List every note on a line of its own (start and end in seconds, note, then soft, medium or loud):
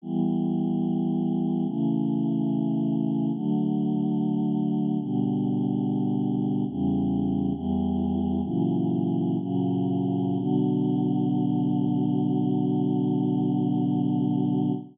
0.02 1.65 E3 medium
0.02 1.66 G3 medium
0.02 1.66 B3 medium
1.66 3.31 C#3 medium
1.66 3.31 E3 medium
1.66 3.31 A3 medium
3.33 4.98 D3 medium
3.33 4.98 F#3 medium
3.33 4.98 A3 medium
4.99 6.64 B2 medium
4.99 6.64 D3 medium
4.99 6.64 G3 medium
6.68 7.52 E2 medium
6.68 7.52 C#3 medium
6.68 7.52 G3 medium
7.52 8.41 E2 loud
7.52 8.41 E3 medium
7.52 8.41 G3 medium
8.43 9.37 A#2 medium
8.43 9.37 C#3 medium
8.43 9.37 E3 medium
8.43 9.37 F#3 medium
9.38 10.38 A#2 medium
9.38 10.38 C#3 medium
9.38 10.36 F#3 medium
9.38 10.38 A#3 medium
10.37 14.72 B2 loud
10.37 14.72 D3 loud
10.37 14.72 F#3 loud